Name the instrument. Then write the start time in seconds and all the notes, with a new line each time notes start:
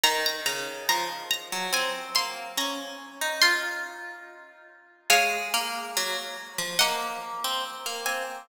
pizzicato strings
0.03 D#3 A#5
0.26 A#5
0.46 C#3 A#5
0.89 F3 A#5
1.31 A#5
1.52 F#3
1.73 C4 G#5
2.15 A#3 C6
2.57 C#4 A#5
3.21 D#4
3.42 F4 C6
5.10 G#3 C#5 F5
5.54 A#3
5.97 F#3
6.58 F3
6.79 A#3 D#5 F#5
7.44 C4
7.86 A#3
8.06 C4 G#5